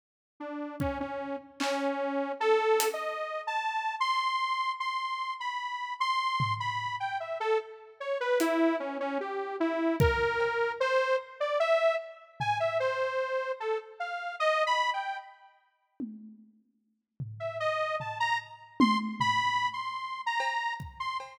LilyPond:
<<
  \new Staff \with { instrumentName = "Lead 2 (sawtooth)" } { \time 3/4 \tempo 4 = 75 r8 d'8 cis'16 cis'8 r16 cis'4 | \tuplet 3/2 { a'4 dis''4 a''4 } c'''4 | c'''8. b''8. c'''8. b''8 g''16 | e''16 a'16 r8 cis''16 b'16 e'8 cis'16 cis'16 g'8 |
e'8 ais'4 c''8 r16 d''16 e''8 | r8 gis''16 e''16 c''4 a'16 r16 f''8 | \tuplet 3/2 { dis''8 b''8 g''8 } r2 | r8. e''16 dis''8 a''16 ais''16 r8 c'''16 r16 |
\tuplet 3/2 { b''4 c'''4 ais''4 } r16 c'''16 r8 | }
  \new DrumStaff \with { instrumentName = "Drums" } \drummode { \time 3/4 r4 bd4 hc4 | r8 hh8 r4 r4 | r4 r4 tomfh4 | r4 r8 hh8 r4 |
r8 bd8 cb4 r4 | r8 tomfh8 r4 r4 | r4 r4 tommh4 | r8 tomfh8 r8 tomfh8 r8 tommh8 |
tomfh4 r8 cb8 bd8 cb8 | }
>>